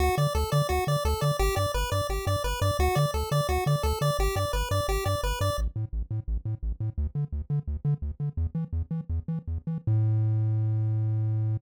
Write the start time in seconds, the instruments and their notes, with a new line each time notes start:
0.00 synth bass 1 D2, lead 1 (square) F#4
0.18 synth bass 1 D3, lead 1 (square) D5
0.35 synth bass 1 D2, lead 1 (square) A4
0.52 synth bass 1 D3, lead 1 (square) D5
0.69 synth bass 1 D2, lead 1 (square) F#4
0.87 synth bass 1 D3, lead 1 (square) D5
1.05 synth bass 1 D2, lead 1 (square) A4
1.21 synth bass 1 D3, lead 1 (square) D5
1.39 synth bass 1 G1, lead 1 (square) G4
1.56 synth bass 1 G2, lead 1 (square) D5
1.74 synth bass 1 G1, lead 1 (square) B4
1.92 synth bass 1 G2, lead 1 (square) D5
2.09 synth bass 1 G1, lead 1 (square) G4
2.27 synth bass 1 G2, lead 1 (square) D5
2.44 synth bass 1 G1, lead 1 (square) B4
2.62 synth bass 1 G2, lead 1 (square) D5
2.79 synth bass 1 D2, lead 1 (square) F#4
2.95 synth bass 1 D3, lead 1 (square) D5
3.14 synth bass 1 D2, lead 1 (square) A4
3.31 synth bass 1 D3, lead 1 (square) D5
3.49 synth bass 1 D2, lead 1 (square) F#4
3.66 synth bass 1 D3, lead 1 (square) D5
3.83 synth bass 1 D2, lead 1 (square) A4
4.01 synth bass 1 D3, lead 1 (square) D5
4.19 synth bass 1 G1, lead 1 (square) G4
4.36 synth bass 1 G2, lead 1 (square) D5
4.53 synth bass 1 G1, lead 1 (square) B4
4.71 synth bass 1 G2, lead 1 (square) D5
4.88 synth bass 1 G1, lead 1 (square) G4
5.06 synth bass 1 G2, lead 1 (square) D5
5.23 synth bass 1 G1, lead 1 (square) B4
5.41 synth bass 1 G2, lead 1 (square) D5
5.58 synth bass 1 A1
5.76 synth bass 1 A2
5.93 synth bass 1 A1
6.11 synth bass 1 A2
6.28 synth bass 1 A1
6.45 synth bass 1 A2
6.63 synth bass 1 A1
6.80 synth bass 1 A2
6.98 synth bass 1 D2
7.15 synth bass 1 D3
7.32 synth bass 1 D2
7.50 synth bass 1 D3
7.68 synth bass 1 D2
7.85 synth bass 1 D3
8.02 synth bass 1 D2
8.20 synth bass 1 D3
8.37 synth bass 1 E2
8.55 synth bass 1 E3
8.73 synth bass 1 E2
8.91 synth bass 1 E3
9.10 synth bass 1 E2
9.28 synth bass 1 E3
9.48 synth bass 1 E2
9.67 synth bass 1 E3
9.87 synth bass 1 A2